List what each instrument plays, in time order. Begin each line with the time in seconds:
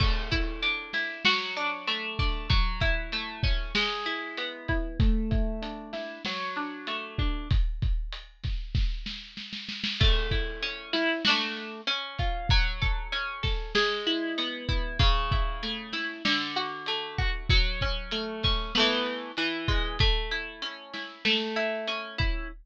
0.00 pizzicato strings A3, kick, crash
0.31 pizzicato strings E4, kick, closed hi-hat
0.62 pizzicato strings D4, closed hi-hat
0.93 pizzicato strings E4, snare, closed hi-hat
1.25 pizzicato strings F#3, snare
1.57 pizzicato strings D4, closed hi-hat
1.87 pizzicato strings A3, closed hi-hat
2.19 pizzicato strings D4, kick, open hi-hat
2.50 pizzicato strings F#3, kick, closed hi-hat
2.80 pizzicato strings E4, kick, closed hi-hat
3.12 pizzicato strings A3, closed hi-hat
3.43 pizzicato strings C#4, kick, snare, closed hi-hat
3.75 pizzicato strings G#3, snare
4.05 pizzicato strings E4, closed hi-hat
4.37 pizzicato strings B3, closed hi-hat
4.68 pizzicato strings E4, kick, closed hi-hat
5.00 pizzicato strings A3, kick, closed hi-hat
5.31 pizzicato strings E4, kick, closed hi-hat
5.62 pizzicato strings D4, closed hi-hat
5.93 pizzicato strings E4, snare, closed hi-hat
6.25 pizzicato strings F#3, snare
6.56 pizzicato strings D4, closed hi-hat
6.87 pizzicato strings A3, closed hi-hat
7.18 pizzicato strings D4, kick, closed hi-hat
7.51 kick, closed hi-hat
7.82 kick, closed hi-hat
8.12 closed hi-hat
8.43 kick, snare, closed hi-hat
8.75 kick, snare
9.06 snare
9.37 snare
9.53 snare
9.69 snare
9.84 snare
10.00 pizzicato strings A3, kick, crash
10.31 pizzicato strings E4, kick, closed hi-hat
10.62 pizzicato strings C#4, closed hi-hat
10.93 pizzicato strings E4, snare, closed hi-hat
11.25 pizzicato strings D4 F#4, snare
11.29 pizzicato strings A3
11.57 closed hi-hat
11.87 pizzicato strings C#4, closed hi-hat
12.18 pizzicato strings F4, kick, closed hi-hat
12.49 pizzicato strings F#3, kick, closed hi-hat
12.82 pizzicato strings A4, kick, closed hi-hat
13.12 pizzicato strings C#4, closed hi-hat
13.43 pizzicato strings A4, kick, snare, closed hi-hat
13.75 pizzicato strings G#3, snare
14.07 pizzicato strings E4, closed hi-hat
14.38 pizzicato strings B3, closed hi-hat
14.69 pizzicato strings E4, kick, closed hi-hat
14.99 pizzicato strings C#3, kick, closed hi-hat
15.32 pizzicato strings E4, kick, closed hi-hat
15.63 pizzicato strings A3, closed hi-hat
15.93 pizzicato strings E4, snare, closed hi-hat
16.25 pizzicato strings D3, snare
16.56 pizzicato strings F#4, closed hi-hat
16.86 pizzicato strings A3, closed hi-hat
17.18 pizzicato strings F#4, kick, closed hi-hat
17.49 pizzicato strings F#3, kick, closed hi-hat
17.81 pizzicato strings C#4, kick, closed hi-hat
18.11 pizzicato strings A3, closed hi-hat
18.43 pizzicato strings C#4, kick, snare, closed hi-hat
18.75 pizzicato strings A3 B3, snare
18.79 pizzicato strings E3
19.06 closed hi-hat
19.37 pizzicato strings E3, closed hi-hat
19.68 pizzicato strings G#3, kick, closed hi-hat
19.99 pizzicato strings A3, kick, closed hi-hat
20.31 pizzicato strings E4, closed hi-hat
20.62 pizzicato strings C#4, closed hi-hat
20.93 pizzicato strings E4, snare, closed hi-hat
21.25 pizzicato strings A3, snare
21.56 pizzicato strings E4, closed hi-hat
21.88 pizzicato strings C#4, closed hi-hat
22.18 pizzicato strings E4, kick, closed hi-hat